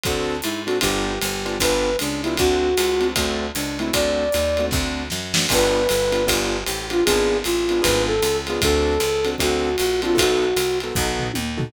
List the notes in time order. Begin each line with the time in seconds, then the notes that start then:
0.03 D2 C4 D4 F#4 A4, kick, ride
0.42 G#2 E4, hi-hat pedal, ride
0.66 C4 D4 F#4 A4, ride
0.81 G1 B3 D4 F4 G4, kick, ride
1.22 G1, hi-hat pedal, ride
1.45 B3 D4 F4 G4, ride
1.60 G1 B3 D4 F4 G4 B4, kick, ride
1.99 C#2 D4, hi-hat pedal, ride
2.22 B3 D4 E4 F4 G4, ride
2.37 D2 A3 C4 D4 F#4, kick, ride
2.77 C#2, hi-hat pedal, ride
3.00 A3 C4 D4 F#4, ride
3.16 D2 A3 C4 D4 F#4, kick, ride
3.54 C#2 D4, hi-hat pedal, ride
3.79 A3 C4 D4 E4 F#4, ride
3.93 D2 A3 C4 D4 F#4 D5, kick, ride
4.32 D#2, hi-hat pedal, ride
4.57 A3 C4 D4 F#4, ride
4.71 D2 A3 C4 D4 F#4, kick, snare
5.10 F#2, snare
5.34 A3 C4 D4 F#4, snare
5.49 G1 B3 D4 F4 G4 B4, kick, crash, ride
5.89 G1, hi-hat pedal, ride
6.12 B3 D4 F4 G4, ride
6.27 G1 B3 D4 F4 G4, kick, ride
6.65 A1 G4, hi-hat pedal, ride
6.90 B3 D4 F4 G4, ride
7.05 G#1 B3 D4 F4 G#4, kick, ride
7.44 A1 F4, hi-hat pedal, ride
7.69 B3 D4 F4 G#4, ride
7.82 G#1 B3 D4 F4 G#4 B4, kick, ride
8.07 A4
8.22 C#2, hi-hat pedal, ride
8.47 B3 D4 F4 G#4, ride
8.62 D2 C4 D4 F#4 A4, kick, ride
9.00 C#2, hi-hat pedal, ride
9.25 C4 D4 F#4 A4, ride
9.38 D2 C4 D4 F#4 A4, kick, ride
9.77 A#1 F#4, hi-hat pedal, ride
10.02 C4 D4 F4 F#4 A4, ride
10.15 B1 B3 D#4 F#4 A4, kick
10.19 F#4, ride
10.56 C2, hi-hat pedal, ride
10.80 B3 D#4 F#4 A4, ride
10.95 B1 B3 D#4 F#4 A4, kick
11.19 floor tom
11.34 D#2, high tom
11.57 B3 D#4 F#4 A4, floor tom